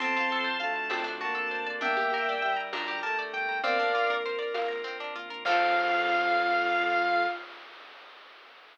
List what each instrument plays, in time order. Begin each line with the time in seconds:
0.00 drawbar organ F2 C4 F4 A4, violin C4, overdriven guitar C4, lead 1 (square) A5 C6, low conga
0.17 overdriven guitar F4
0.32 overdriven guitar A4
0.44 overdriven guitar C5
0.60 drawbar organ D2, violin A3, overdriven guitar F5, lead 1 (square) A5
0.76 overdriven guitar A5
0.90 overdriven guitar C4, drawbar organ C4 D4 F#4 A4, tambourine, high conga
1.04 overdriven guitar D4
1.21 violin A#3, overdriven guitar F#4, lead 1 (square) A5
1.35 overdriven guitar A4
1.51 overdriven guitar C5
1.67 overdriven guitar D5
1.81 drawbar organ G1 D4 G4 A#4, violin A#3, overdriven guitar D4, lead 1 (square) E5 G5, low conga
1.97 drawbar organ G1, overdriven guitar G4
2.14 overdriven guitar A#4
2.27 drawbar organ G1, overdriven guitar D5
2.42 drawbar organ G1, violin G3, overdriven guitar G5
2.57 overdriven guitar A#5
2.73 overdriven guitar D4, lead 1 (square) A#5, tambourine, high conga
2.88 drawbar organ D2, overdriven guitar G4
3.03 violin A3, overdriven guitar A#4, lead 1 (square) A5
3.19 overdriven guitar D5
3.33 drawbar organ G1, lead 1 (square) G5, overdriven guitar G5
3.49 drawbar organ G1, overdriven guitar A#5
3.63 drawbar organ A#1 C4 D4 F4 A#4, overdriven guitar C4, violin A#4, lead 1 (square) D5 F5, low conga
3.79 drawbar organ A#1, overdriven guitar D4
3.95 overdriven guitar F4
4.09 drawbar organ A#1, overdriven guitar A#4
4.24 drawbar organ A#1, overdriven guitar C5
4.39 overdriven guitar D5
4.54 overdriven guitar F5, tambourine, high conga
4.68 drawbar organ A#1, overdriven guitar A#5
4.84 overdriven guitar C4
5.00 overdriven guitar D4
5.15 drawbar organ A#1, overdriven guitar F4
5.30 drawbar organ A#1, overdriven guitar A#4
5.45 drawbar organ F2 C4 F4 A4, overdriven guitar C4 F4 A4, violin F4, lead 1 (square) F5, kick, crash